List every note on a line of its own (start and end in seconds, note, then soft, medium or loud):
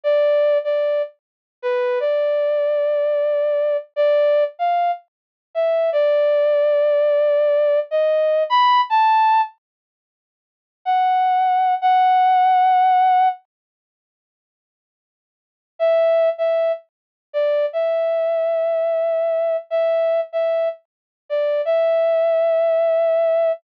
0.03 0.58 D5 loud
0.64 1.02 D5 medium
1.62 1.99 B4 medium
2.00 3.77 D5 medium
3.96 4.44 D5 loud
4.59 4.91 F5 medium
5.55 5.90 E5 medium
5.92 7.80 D5 medium
7.91 8.43 D#5 medium
8.50 8.81 B5 medium
8.90 9.41 A5 medium
10.85 11.75 F#5 medium
11.82 13.28 F#5 loud
15.79 16.29 E5 medium
16.38 16.72 E5 medium
17.33 17.66 D5 medium
17.73 19.57 E5 medium
19.70 20.20 E5 medium
20.33 20.69 E5 medium
21.29 21.61 D5 medium
21.65 23.52 E5 medium